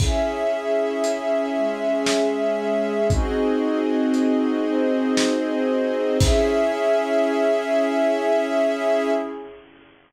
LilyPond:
<<
  \new Staff \with { instrumentName = "Pad 2 (warm)" } { \time 3/4 \key cis \minor \tempo 4 = 58 <cis' e' gis'>4. <gis cis' gis'>4. | <bis dis' fis' gis'>4. <bis dis' gis' bis'>4. | <cis' e' gis'>2. | }
  \new Staff \with { instrumentName = "String Ensemble 1" } { \time 3/4 \key cis \minor <cis' gis' e''>2. | <bis fis' gis' dis''>2. | <cis' gis' e''>2. | }
  \new DrumStaff \with { instrumentName = "Drums" } \drummode { \time 3/4 <cymc bd>4 hh4 sn4 | <hh bd>4 hh4 sn4 | <cymc bd>4 r4 r4 | }
>>